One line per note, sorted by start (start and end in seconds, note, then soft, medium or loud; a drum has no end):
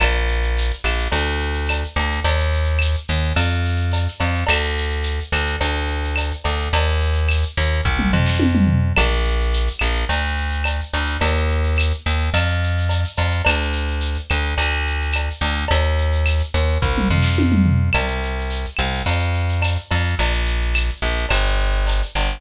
0.00 0.72 A#1 medium
0.00 cowbell loud
0.00 claves loud
0.00 shaker loud
0.12 shaker medium
0.28 shaker medium
0.42 shaker medium
0.56 tambourine medium
0.56 shaker loud
0.70 shaker medium
0.84 1.08 A#1 medium
0.84 claves loud
0.84 shaker loud
0.99 shaker medium
1.12 1.84 D2 medium
1.12 cowbell loud
1.12 shaker loud
1.27 shaker medium
1.39 shaker medium
1.54 shaker medium
1.66 tambourine loud
1.66 cowbell medium
1.66 claves loud
1.66 shaker loud
1.84 shaker medium
1.96 2.20 D2 medium
1.96 cowbell medium
1.96 shaker medium
2.11 shaker medium
2.24 2.96 D#2 medium
2.24 cowbell loud
2.24 shaker loud
2.39 shaker medium
2.53 shaker medium
2.64 shaker medium
2.79 tambourine medium
2.79 claves loud
2.79 shaker loud
2.94 shaker medium
3.08 3.33 D#2 medium
3.08 shaker loud
3.21 shaker medium
3.36 4.08 F2 medium
3.36 cowbell medium
3.36 claves medium
3.36 shaker loud
3.49 shaker medium
3.65 shaker medium
3.77 shaker medium
3.91 tambourine medium
3.91 cowbell medium
3.91 shaker loud
4.08 shaker medium
4.20 4.44 F2 medium
4.20 cowbell medium
4.20 shaker loud
4.35 shaker medium
4.47 5.20 D2 medium
4.47 cowbell loud
4.47 claves loud
4.47 shaker loud
4.64 shaker medium
4.78 shaker loud
4.89 shaker medium
5.03 tambourine medium
5.03 shaker loud
5.20 shaker medium
5.32 5.56 D2 medium
5.32 claves loud
5.32 shaker medium
5.47 shaker medium
5.61 6.32 D2 medium
5.61 cowbell medium
5.61 shaker loud
5.75 shaker medium
5.88 shaker medium
6.04 shaker medium
6.16 tambourine medium
6.16 cowbell medium
6.16 claves loud
6.16 shaker loud
6.31 shaker medium
6.44 6.69 D2 medium
6.44 cowbell medium
6.44 shaker medium
6.59 shaker medium
6.73 7.44 D#2 medium
6.73 cowbell loud
6.73 shaker loud
6.88 shaker medium
7.00 shaker medium
7.13 shaker medium
7.29 tambourine medium
7.29 claves loud
7.29 shaker loud
7.43 shaker medium
7.57 7.81 D#2 medium
7.57 shaker loud
7.72 shaker medium
7.85 8.12 C2 medium
7.85 kick loud
7.99 mid tom loud
8.13 8.93 F2 medium
8.13 floor tom loud
8.26 snare medium
8.39 high tom loud
8.55 mid tom loud
8.67 floor tom loud
8.96 9.69 A#1 medium
8.96 cowbell loud
8.96 claves loud
8.96 shaker loud
9.12 shaker medium
9.25 shaker medium
9.39 shaker medium
9.52 tambourine medium
9.52 shaker loud
9.67 shaker medium
9.79 10.05 A#1 medium
9.79 claves loud
9.79 shaker loud
9.94 shaker medium
10.09 10.81 D2 medium
10.09 cowbell loud
10.09 shaker loud
10.24 shaker medium
10.38 shaker medium
10.50 shaker medium
10.64 tambourine loud
10.64 cowbell medium
10.64 claves loud
10.64 shaker loud
10.80 shaker medium
10.93 11.17 D2 medium
10.93 cowbell medium
10.93 shaker medium
11.06 shaker medium
11.21 11.93 D#2 medium
11.21 cowbell loud
11.21 shaker loud
11.34 shaker medium
11.48 shaker medium
11.64 shaker medium
11.76 tambourine medium
11.76 claves loud
11.76 shaker loud
11.90 shaker medium
12.06 12.30 D#2 medium
12.06 shaker loud
12.20 shaker medium
12.33 13.05 F2 medium
12.33 cowbell medium
12.33 claves medium
12.33 shaker loud
12.48 shaker medium
12.63 shaker medium
12.78 shaker medium
12.89 tambourine medium
12.89 cowbell medium
12.89 shaker loud
13.04 shaker medium
13.17 13.42 F2 medium
13.17 cowbell medium
13.17 shaker loud
13.31 shaker medium
13.45 14.18 D2 medium
13.45 cowbell loud
13.45 claves loud
13.45 shaker loud
13.61 shaker medium
13.73 shaker loud
13.87 shaker medium
14.01 tambourine medium
14.01 shaker loud
14.14 shaker medium
14.30 14.54 D2 medium
14.30 claves loud
14.30 shaker medium
14.43 shaker medium
14.57 15.29 D2 medium
14.57 cowbell medium
14.57 shaker loud
14.71 shaker medium
14.87 shaker medium
15.01 shaker medium
15.12 tambourine medium
15.12 cowbell medium
15.12 claves loud
15.12 shaker loud
15.30 shaker medium
15.41 15.65 D2 medium
15.41 cowbell medium
15.41 shaker medium
15.55 shaker medium
15.68 16.42 D#2 medium
15.68 cowbell loud
15.68 shaker loud
15.84 shaker medium
15.98 shaker medium
16.12 shaker medium
16.26 tambourine medium
16.26 claves loud
16.26 shaker loud
16.39 shaker medium
16.54 16.78 D#2 medium
16.54 shaker loud
16.68 shaker medium
16.82 17.09 C2 medium
16.82 kick loud
16.98 mid tom loud
17.10 17.90 F2 medium
17.10 floor tom loud
17.22 snare medium
17.38 high tom loud
17.52 mid tom loud
17.66 floor tom loud
17.93 18.66 C2 medium
17.93 cowbell loud
17.93 claves loud
17.93 shaker loud
18.08 shaker medium
18.23 shaker medium
18.38 shaker medium
18.50 tambourine medium
18.50 shaker loud
18.65 shaker medium
18.77 19.02 C2 medium
18.77 claves loud
18.77 shaker medium
18.94 shaker medium
19.06 19.77 F2 medium
19.06 cowbell medium
19.06 shaker loud
19.20 shaker medium
19.34 shaker medium
19.49 shaker medium
19.62 tambourine medium
19.62 cowbell medium
19.62 claves loud
19.62 shaker loud
19.75 shaker medium
19.91 20.15 F2 medium
19.91 cowbell medium
19.91 shaker medium
20.05 shaker medium
20.19 20.90 A#1 medium
20.19 cowbell loud
20.19 shaker loud
20.33 shaker medium
20.46 shaker loud
20.61 shaker medium
20.74 tambourine medium
20.74 claves loud
20.74 shaker loud
20.89 shaker medium
21.02 21.26 A#1 medium
21.02 shaker medium
21.16 shaker medium
21.29 22.02 G1 medium
21.29 cowbell medium
21.29 claves loud
21.29 shaker loud
21.46 shaker medium
21.59 shaker medium
21.71 shaker medium
21.87 tambourine medium
21.87 cowbell medium
21.87 shaker loud
22.02 shaker medium
22.15 22.39 G1 medium
22.15 cowbell medium
22.15 shaker loud
22.28 shaker medium